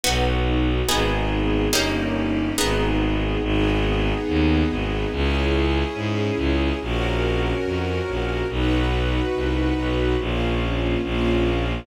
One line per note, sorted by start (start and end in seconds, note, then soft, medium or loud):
0.04 0.82 B1 medium
0.04 0.87 B3 medium
0.04 0.80 B3 medium
0.04 0.87 D#4 medium
0.04 0.80 D#4 medium
0.04 0.87 F#4 medium
0.04 0.80 F#4 medium
0.87 1.68 G#1 medium
0.87 1.71 B3 medium
0.87 1.65 B3 medium
0.87 1.71 D#4 medium
0.87 1.65 D#4 medium
0.87 1.71 G#4 medium
0.87 1.65 G#4 medium
1.73 2.52 G1 medium
1.73 2.49 A#3 medium
1.73 2.57 A#3 medium
1.73 2.49 C#4 medium
1.73 2.57 C#4 medium
1.73 2.49 D#4 medium
1.73 2.57 D#4 medium
1.73 2.49 G4 medium
1.73 2.57 G4 medium
2.58 3.37 G#1 medium
2.58 3.34 B3 medium
2.58 3.42 B3 medium
2.58 3.34 D#4 medium
2.58 3.42 D#4 medium
2.58 3.34 G#4 medium
2.58 3.42 G#4 medium
3.41 4.13 G#1 loud
3.41 5.11 B3 loud
3.41 5.11 D#4 medium
3.41 5.11 G#4 medium
4.28 4.64 D#2 medium
4.70 5.06 G#1 medium
5.12 5.84 C#2 loud
5.12 6.79 C#4 medium
5.12 6.79 E4 medium
5.12 6.79 G#4 medium
5.95 6.31 G#2 medium
6.36 6.72 C#2 medium
6.79 7.53 A#1 medium
6.79 8.47 C#4 medium
6.79 8.47 F#4 medium
6.79 8.47 A#4 medium
7.64 8.00 F2 medium
8.08 8.43 A#1 medium
8.49 9.21 B1 medium
8.49 10.17 D#4 medium
8.49 10.17 F#4 medium
8.49 10.17 B4 medium
9.34 9.72 C2 medium
9.78 10.16 B1 medium
10.18 10.96 A#1 medium
10.18 11.01 A#3 medium
10.18 11.01 C#4 medium
10.18 11.01 F4 medium
11.02 11.80 A#1 medium
11.02 11.85 A#3 loud
11.02 11.85 C#4 medium
11.02 11.85 F4 medium